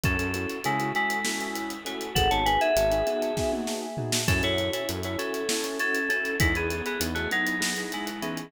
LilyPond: <<
  \new Staff \with { instrumentName = "Electric Piano 2" } { \time 7/8 \key fis \dorian \tempo 4 = 99 <cis' a'>4 <gis e'>8 <gis e'>4. <a fis'>8 | <a' fis''>16 <cis'' a''>16 <b' gis''>16 <gis' e''>4.~ <gis' e''>16 r4 | <cis' a'>16 <e' cis''>8 <e' cis''>16 r16 <e' cis''>16 <cis' a'>4 <cis' a'>8 <cis' a'>8 | <gis e'>16 <b gis'>8 <b gis'>16 r16 <a fis'>16 <fis dis'>4 <gis e'>8 <e cis'>8 | }
  \new Staff \with { instrumentName = "Acoustic Grand Piano" } { \time 7/8 \key fis \dorian <cis' e' fis' a'>16 <cis' e' fis' a'>16 <cis' e' fis' a'>8 <cis' e' fis' a'>16 <cis' e' fis' a'>16 <cis' e' fis' a'>8 <cis' e' fis' a'>4 <cis' e' fis' a'>8 | <b dis' fis' gis'>16 <b dis' fis' gis'>16 <b dis' fis' gis'>8 <b dis' fis' gis'>16 <b dis' fis' gis'>16 <b dis' fis' gis'>8 <b dis' fis' gis'>4 <b dis' fis' gis'>8 | <cis' e' fis' a'>16 <cis' e' fis' a'>16 <cis' e' fis' a'>8 <cis' e' fis' a'>16 <cis' e' fis' a'>16 <cis' e' fis' a'>8 <cis' e' fis' a'>4 <cis' e' fis' a'>8 | <b dis' e' gis'>16 <b dis' e' gis'>16 <b dis' e' gis'>8 <b dis' e' gis'>16 <b dis' e' gis'>16 <b dis' e' gis'>8 <b dis' e' gis'>4 <b dis' e' gis'>8 | }
  \new Staff \with { instrumentName = "Synth Bass 1" } { \clef bass \time 7/8 \key fis \dorian fis,16 fis,8. cis2~ cis8 | gis,,16 gis,,8. gis,,2~ gis,,8 | fis,16 fis,8. fis,2~ fis,8 | e,16 e,8. e,2~ e,8 | }
  \new DrumStaff \with { instrumentName = "Drums" } \drummode { \time 7/8 <hh bd>16 hh16 hh16 hh16 hh16 hh16 hh16 hh16 sn16 hh16 hh16 hh16 hh16 hh16 | <hh bd>16 hh16 hh16 hh16 hh16 hh16 hh16 hh16 <bd sn>16 tommh16 sn8 tomfh16 sn16 | <hh bd>16 hh16 hh16 hh16 hh16 hh16 hh16 hh16 sn16 hh16 hh16 hh16 hh16 hh16 | <hh bd>16 hh16 hh16 hh16 hh16 hh16 hh16 hh16 sn16 hh16 hh16 hh16 hh16 hh16 | }
>>